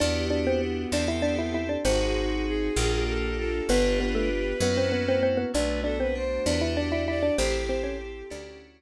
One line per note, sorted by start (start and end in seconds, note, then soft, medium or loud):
0.00 0.86 E2 loud
0.00 1.57 B3 loud
0.00 0.83 D4 medium
0.00 0.91 D4 medium
0.00 0.26 D4 medium
0.00 0.83 E4 medium
0.00 0.91 E4 medium
0.00 0.83 F#4 medium
0.00 0.91 F#4 medium
0.00 0.83 G4 medium
0.00 0.91 G4 medium
0.00 0.26 D5 medium
0.30 0.45 D4 medium
0.30 0.45 D5 medium
0.47 0.61 C4 medium
0.47 0.61 C5 medium
0.92 1.77 E2 loud
0.92 1.84 C4 medium
0.92 1.76 C4 medium
0.92 1.08 D4 medium
0.92 1.84 E4 medium
0.92 1.76 E4 medium
0.92 1.84 G4 medium
0.92 1.76 G4 medium
0.92 1.84 A4 medium
0.92 1.76 A4 medium
0.92 1.08 D5 medium
1.08 1.23 E4 medium
1.08 1.23 E5 medium
1.22 1.37 D4 medium
1.22 1.37 D5 medium
1.39 1.53 E4 medium
1.39 1.53 E5 medium
1.54 1.69 E4 medium
1.54 1.69 E5 medium
1.69 1.84 D4 medium
1.69 1.84 D5 medium
1.85 2.70 G#1 loud
1.85 2.68 C4 medium
1.85 2.76 C4 medium
1.85 3.01 C4 medium
1.85 2.68 D#4 loud
1.85 2.76 D#4 medium
1.85 2.68 F#4 medium
1.85 2.76 F#4 medium
1.85 2.45 F#4 loud
1.85 2.68 G#4 medium
1.85 2.76 G#4 medium
1.85 3.01 C5 medium
2.47 3.00 G#4 loud
2.76 3.61 A#1 loud
2.76 3.60 A#3 medium
2.76 3.68 A#3 medium
2.76 3.60 D4 medium
2.76 3.68 D4 medium
2.76 3.60 F4 medium
2.76 3.68 F4 medium
2.76 3.60 G4 medium
2.76 3.68 G4 medium
3.08 3.37 A4 loud
3.38 3.67 A4 loud
3.69 4.54 G1 loud
3.69 4.61 B3 medium
3.69 4.53 B3 medium
3.69 3.99 B3 loud
3.69 4.61 D4 medium
3.69 4.53 D4 medium
3.69 4.61 F4 medium
3.69 4.53 F4 medium
3.69 4.61 G4 medium
3.69 4.53 G4 medium
3.69 5.17 B4 loud
3.69 3.99 B4 loud
4.00 4.15 B3 medium
4.00 4.15 B4 medium
4.15 4.29 A3 medium
4.15 4.29 A4 medium
4.60 5.45 F#2 loud
4.60 5.53 A#3 medium
4.60 5.45 A#3 medium
4.60 4.77 B3 medium
4.60 5.53 C#4 medium
4.60 5.45 C#4 medium
4.60 5.53 E4 medium
4.60 5.45 E4 medium
4.60 5.53 F#4 medium
4.60 5.45 F#4 medium
4.60 4.77 B4 medium
4.77 4.92 C4 medium
4.77 4.92 C5 medium
4.92 5.06 B3 medium
4.92 5.06 B4 medium
5.08 5.22 C4 medium
5.08 5.22 C5 loud
5.23 5.37 C4 medium
5.23 5.37 C5 medium
5.37 5.52 B3 medium
5.37 5.52 B4 medium
5.54 6.39 B1 loud
5.54 5.81 A3 medium
5.54 6.45 A3 medium
5.54 6.45 B3 medium
5.54 6.45 D4 medium
5.54 5.81 D4 medium
5.54 6.45 F#4 medium
5.54 5.80 B4 loud
5.54 5.81 D5 medium
5.84 6.13 B3 medium
5.84 5.98 D4 medium
5.84 5.99 A4 loud
5.84 5.98 D5 medium
6.00 6.15 C4 medium
6.00 6.15 B4 loud
6.00 6.15 C5 medium
6.15 6.43 D4 medium
6.15 6.45 C5 loud
6.46 7.31 E2 loud
6.46 7.38 D4 medium
6.46 6.61 D4 medium
6.46 7.29 D4 medium
6.46 7.38 E4 medium
6.46 7.29 E4 medium
6.46 7.38 F#4 medium
6.46 7.29 F#4 medium
6.46 7.38 G4 medium
6.46 7.29 G4 medium
6.46 6.73 B4 loud
6.46 6.61 D5 medium
6.61 6.76 E4 medium
6.61 6.76 E5 medium
6.77 6.92 D4 medium
6.77 6.92 D5 medium
6.77 7.03 D5 loud
6.92 7.07 E4 medium
6.92 7.07 E5 medium
7.08 7.23 E4 medium
7.08 7.33 D5 loud
7.08 7.23 E5 medium
7.23 7.37 D4 medium
7.23 7.37 D5 medium
7.38 8.23 A1 loud
7.38 7.63 C4 medium
7.38 8.30 C4 medium
7.38 8.22 C4 medium
7.38 8.30 E4 medium
7.38 8.22 E4 medium
7.38 8.58 G4 loud
7.38 8.30 G4 medium
7.38 8.22 G4 medium
7.38 8.30 A4 medium
7.38 8.22 A4 medium
7.38 7.63 C5 medium
7.69 7.84 C4 medium
7.69 7.84 C5 medium
7.83 7.98 C#4 medium
7.83 7.98 C#5 medium
8.30 8.82 D2 loud
8.30 8.82 C#4 medium
8.30 8.82 D4 medium
8.30 8.82 E4 medium
8.30 8.82 F#4 medium
8.30 8.82 D5 medium